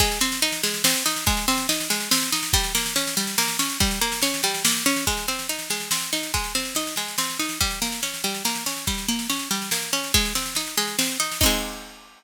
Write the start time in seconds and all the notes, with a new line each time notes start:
0.00 G#3, kick, snare
0.11 snare
0.21 C4, snare
0.32 snare
0.42 D#4, snare
0.52 snare
0.63 G#3, snare
0.74 snare
0.84 C4, snare
0.95 snare
1.06 D#4, snare
1.16 snare
1.26 G#3, kick, snare
1.37 snare
1.48 C4, snare
1.58 snare
1.69 D#4, snare
1.80 snare
1.90 G#3, snare
2.00 snare
2.11 C4, snare
2.22 snare
2.32 D#4, snare
2.43 snare
2.53 G3, kick, snare
2.64 snare
2.75 A#3, snare
2.86 snare
2.96 C#4, snare
3.07 snare
3.17 G3, snare
3.27 snare
3.38 A#3, snare
3.48 snare
3.59 C#4, snare
3.70 snare
3.80 G3, kick, snare
3.91 snare
4.01 A#3, snare
4.12 snare
4.22 C#4, snare
4.34 snare
4.43 G3, snare
4.54 snare
4.65 A#3, snare
4.77 snare
4.86 C#4, snare
4.96 snare
5.07 G#3, kick, snare
5.17 snare
5.28 C4, snare
5.39 snare
5.49 D#4, snare
5.59 snare
5.70 G#3, snare
5.80 snare
5.91 C4, snare
6.01 snare
6.13 D#4, snare
6.23 snare
6.34 G#3, kick, snare
6.44 snare
6.55 C4, snare
6.65 snare
6.75 D#4, snare
6.87 snare
6.96 G#3, snare
7.08 snare
7.18 C4, snare
7.30 snare
7.39 D#4, snare
7.49 snare
7.61 G3, kick, snare
7.71 snare
7.82 A#3, snare
7.92 snare
8.03 C#4, snare
8.14 snare
8.24 G3, snare
8.34 snare
8.45 A#3, snare
8.55 snare
8.66 C#4, snare
8.76 snare
8.87 G3, kick, snare
8.98 snare
9.08 A#3, snare
9.19 snare
9.30 C#4, snare
9.39 snare
9.51 G3, snare
9.62 snare
9.71 A#3, snare
9.82 snare
9.93 C#4, snare
10.04 snare
10.14 G#3, kick, snare
10.25 snare
10.35 C4, snare
10.46 snare
10.55 D#4, snare
10.67 snare
10.77 G#3, snare
10.88 snare
10.99 C4, snare
11.09 snare
11.20 D#4, snare
11.32 snare
11.41 C4 D#4, kick, crash
11.46 G#3